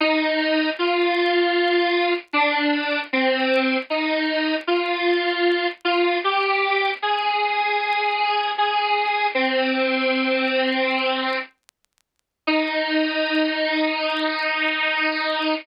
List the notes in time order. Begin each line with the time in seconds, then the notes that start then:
0.00 D#4
0.79 F4
2.33 D4
3.13 C4
3.90 D#4
4.67 F4
5.85 F4
6.24 G4
7.02 G#4
8.58 G#4
9.35 C4
12.47 D#4